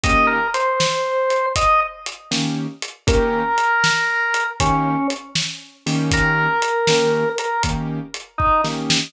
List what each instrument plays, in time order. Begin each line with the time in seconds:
0.04 acoustic grand piano D#3 A#3 C#4 G4, drawbar organ D#5, kick, closed hi-hat
0.27 drawbar organ A#4
0.54 drawbar organ C5, closed hi-hat
0.80 snare
1.30 closed hi-hat
1.56 drawbar organ D#5, kick, closed hi-hat
2.06 closed hi-hat
2.31 acoustic grand piano D#3 A#3 C#4 G4, snare
2.82 closed hi-hat
3.07 acoustic grand piano D#3 A#3 C#4 G4, drawbar organ A#4, kick, closed hi-hat
3.58 closed hi-hat
3.84 snare
4.34 closed hi-hat
4.60 acoustic grand piano D#3 A#3 C#4 G4, drawbar organ C#4, kick, closed hi-hat
5.10 closed hi-hat
5.35 snare
5.86 acoustic grand piano D#3 A#3 C#4 G4, open hi-hat
6.11 drawbar organ A#4, kick, closed hi-hat
6.62 closed hi-hat
6.87 acoustic grand piano D#3 A#3 C#4 G4, snare
7.38 drawbar organ A#4, closed hi-hat
7.63 acoustic grand piano D#3 A#3 C#4 G4, kick, closed hi-hat
8.14 closed hi-hat
8.38 drawbar organ D#4, kick
8.64 acoustic grand piano D#3 A#3 C#4 G4, snare
8.90 snare